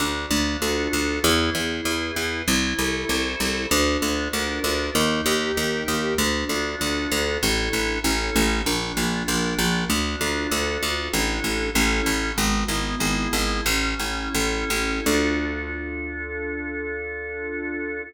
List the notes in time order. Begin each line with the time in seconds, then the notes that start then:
0.00 D2 D4
0.31 D2 F4
0.62 D2 A4
0.93 D2 F4
1.24 E2 E4
1.55 E2 G#4
1.85 E2 B4
2.16 E2 G#4
2.47 C2 E4
2.79 C2 A4
3.09 C2 C5
3.40 C2 A4
3.71 D2 D4
4.02 D2 F4
4.33 D2 A#4
4.64 D2 F4
4.95 D#2 D#4
5.26 D#2 G4
5.56 D#2 A#4
5.88 D#2 G4
6.18 D2 D4
6.49 D2 F4
6.80 D2 A4
7.11 D2 F4
7.43 A1 D4 E4 A4
7.73 A1
8.04 A1 C#4 E4 A4
8.36 A1
8.66 A#1 D4
8.97 A#1 F4
9.28 A#1 A#4
9.59 A#1 F4
9.90 D2 D4
10.21 D2 F4
10.51 D2 A4
10.82 D2 F4
11.13 A1 D4 E4 A4
11.44 A1
11.75 A1 C#4 E4 A4
12.06 A1
12.37 G#1 B3
12.68 G#1 E4
13.00 G#1 G#4
13.33 G#1 E4
13.66 A1 C#4
13.99 A1 E4
14.34 A1 A4
14.70 A1 E4
15.06 D2 D4 F4 A4